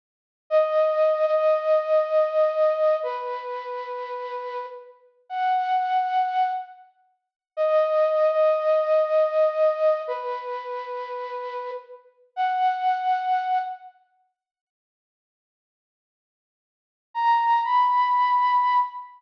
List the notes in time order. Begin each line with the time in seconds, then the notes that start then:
0.50 D#5
1.26 D#5
3.03 B4
5.30 F#5
7.57 D#5
8.32 D#5
10.08 B4
12.36 F#5
17.14 A#5
17.64 B5